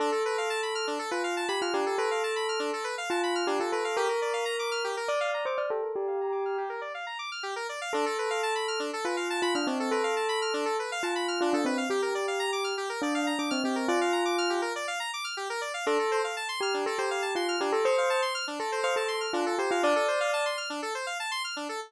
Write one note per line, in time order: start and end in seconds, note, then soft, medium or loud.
0.00 0.10 D4 medium
0.00 0.93 A4 medium
0.12 0.23 A4 medium
0.25 0.37 B4 medium
0.38 0.49 F5 medium
0.50 0.61 A5 medium
0.63 0.74 B5 soft
0.75 0.86 F6 medium
0.87 0.98 D4 medium
0.99 1.10 A4 medium
1.11 1.45 F4 medium
1.11 1.22 B4 medium
1.24 1.35 F5 medium
1.37 1.48 A5 medium
1.48 1.61 G4 medium
1.48 1.60 B5 medium
1.62 1.73 F4 medium
1.62 1.73 F6 medium
1.74 1.85 D4 medium
1.74 1.96 G4 medium
1.86 1.97 A4 medium
1.98 2.85 A4 medium
1.98 2.09 B4 medium
2.11 2.22 F5 medium
2.23 2.35 A5 medium
2.36 2.47 B5 medium
2.49 2.60 F6 medium
2.59 2.71 D4 medium
2.73 2.84 A4 medium
2.84 2.95 B4 medium
2.98 3.09 F5 medium
3.10 3.44 F4 medium
3.10 3.21 A5 medium
3.23 3.35 B5 medium
3.35 3.46 F6 medium
3.47 3.58 D4 medium
3.47 3.59 G4 medium
3.60 3.71 F4 medium
3.60 3.71 A4 medium
3.72 3.95 A4 medium
3.72 3.83 B4 medium
3.85 3.96 F5 medium
3.97 4.08 G4 medium
3.97 4.89 A#4 medium
4.09 4.20 A#4 medium
4.22 4.33 D5 medium
4.33 4.45 F5 medium
4.45 4.56 A#5 medium
4.59 4.70 D6 medium
4.71 4.83 F6 medium
4.84 4.95 G4 medium
4.97 5.08 A#4 medium
5.08 5.19 D5 medium
5.08 5.42 D5 medium
5.20 5.32 F5 medium
5.34 5.45 A#5 medium
5.45 5.57 C5 medium
5.45 5.57 D6 medium
5.57 5.70 D5 medium
5.57 5.68 F6 medium
5.70 5.81 G4 medium
5.70 5.92 A4 medium
5.83 5.94 A#4 medium
5.95 6.63 G4 medium
5.95 6.06 D5 medium
6.08 6.19 F5 medium
6.21 6.32 A#5 medium
6.32 6.43 D6 medium
6.45 6.57 F6 medium
6.58 6.69 G4 medium
6.69 6.81 A#4 medium
6.81 6.92 D5 medium
6.94 7.06 F5 medium
7.07 7.18 A#5 medium
7.19 7.30 D6 medium
7.32 7.43 F6 medium
7.43 7.54 G4 medium
7.56 7.67 A#4 medium
7.69 7.80 D5 medium
7.81 7.92 F5 medium
7.93 8.05 D4 medium
7.93 8.85 A4 medium
8.06 8.17 A4 medium
8.18 8.30 B4 medium
8.30 8.41 F5 medium
8.43 8.54 A5 medium
8.55 8.67 B5 medium
8.68 8.79 F6 medium
8.80 8.91 D4 medium
8.93 9.04 A4 medium
9.05 9.41 F4 medium
9.05 9.16 B4 medium
9.17 9.28 F5 medium
9.30 9.41 A5 medium
9.42 9.54 F4 medium
9.42 9.53 B5 medium
9.55 9.67 D4 medium
9.55 9.66 F6 medium
9.67 9.89 C4 medium
9.67 9.78 D4 medium
9.80 9.91 A4 medium
9.91 10.79 A4 medium
9.91 10.02 B4 medium
10.04 10.15 F5 medium
10.16 10.27 A5 medium
10.29 10.40 B5 medium
10.42 10.53 F6 medium
10.54 10.65 D4 medium
10.65 10.77 A4 medium
10.79 10.90 B4 medium
10.92 11.03 F5 medium
11.03 11.39 F4 medium
11.03 11.14 A5 medium
11.15 11.27 B5 medium
11.28 11.39 F6 medium
11.41 11.53 D4 medium
11.41 11.52 F4 medium
11.53 11.65 D4 medium
11.53 11.65 A4 medium
11.65 11.85 C4 medium
11.65 11.77 B4 medium
11.77 11.89 F5 medium
11.90 12.73 G4 medium
11.90 12.01 G4 medium
12.02 12.13 A#4 medium
12.15 12.26 D5 medium
12.28 12.39 F5 medium
12.39 12.51 A#5 medium
12.52 12.64 D6 medium
12.64 12.75 F6 medium
12.77 12.89 G4 medium
12.89 13.01 A#4 medium
13.02 13.32 D4 medium
13.02 13.14 D5 medium
13.15 13.26 F5 medium
13.27 13.38 A#5 medium
13.39 13.51 D4 medium
13.39 13.50 D6 medium
13.51 13.63 C4 medium
13.51 13.62 F6 medium
13.64 13.86 C4 medium
13.64 13.76 G4 medium
13.76 13.87 A#4 medium
13.88 14.60 F4 medium
13.88 13.99 D5 medium
14.01 14.12 F5 medium
14.13 14.24 A#5 medium
14.25 14.36 D6 medium
14.38 14.49 F6 medium
14.50 14.61 G4 medium
14.62 14.73 A#4 medium
14.76 14.87 D5 medium
14.88 14.99 F5 medium
15.00 15.11 A#5 medium
15.13 15.25 D6 medium
15.24 15.35 F6 medium
15.37 15.48 G4 medium
15.50 15.61 A#4 medium
15.61 15.72 D5 medium
15.74 15.85 F5 medium
15.86 15.97 D4 medium
15.86 16.19 A4 medium
15.99 16.10 A4 medium
16.11 16.23 C5 medium
16.24 16.35 F5 medium
16.37 16.48 A5 medium
16.49 16.60 C6 medium
16.61 16.84 G4 medium
16.61 16.73 F6 medium
16.74 16.85 D4 medium
16.86 16.98 A4 medium
16.98 17.35 G4 medium
16.98 17.09 C5 medium
17.11 17.22 F5 medium
17.22 17.33 A5 medium
17.35 17.56 F4 medium
17.35 17.47 C6 medium
17.48 17.60 F6 medium
17.61 17.72 D4 medium
17.61 17.72 G4 medium
17.72 17.84 A4 medium
17.85 17.96 C5 medium
17.85 18.21 C5 medium
17.98 18.09 F5 medium
18.10 18.21 A5 medium
18.22 18.33 C6 medium
18.35 18.46 F6 medium
18.47 18.59 D4 medium
18.60 18.71 A4 medium
18.60 18.81 A4 medium
18.72 18.83 C5 medium
18.83 18.96 C5 medium
18.83 18.94 F5 medium
18.96 19.26 A4 medium
18.96 19.08 A5 medium
19.08 19.19 C6 medium
19.21 19.32 F6 medium
19.33 19.45 D4 medium
19.33 19.55 F4 medium
19.46 19.57 A4 medium
19.58 19.70 G4 medium
19.58 19.70 C5 medium
19.71 19.83 F4 medium
19.71 19.82 F5 medium
19.83 19.94 D4 medium
19.83 20.48 D5 medium
19.96 20.07 A4 medium
20.08 20.19 C5 medium
20.20 20.32 F5 medium
20.33 20.44 A5 medium
20.46 20.57 C6 medium
20.57 20.69 F6 medium
20.70 20.81 D4 medium
20.82 20.94 A4 medium
20.95 21.06 C5 medium
21.07 21.18 F5 medium
21.20 21.31 A5 medium
21.31 21.42 C6 medium
21.44 21.55 F6 medium
21.56 21.68 D4 medium
21.69 21.80 A4 medium